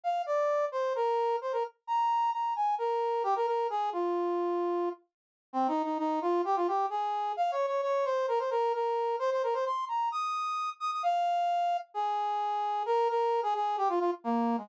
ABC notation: X:1
M:4/4
L:1/16
Q:1/4=131
K:Eb
V:1 name="Brass Section"
f2 d4 c2 B4 c B z2 | b4 b2 a2 B4 G B B2 | A2 F10 z4 | [K:Ab] (3C2 E2 E2 E2 F2 G F G2 A4 |
(3f2 d2 d2 d2 c2 B c B2 B4 | c c B c c'2 b2 e'6 e' e' | f8 A8 | [K:Eb] B2 B3 A A2 G F F z B,3 A, |]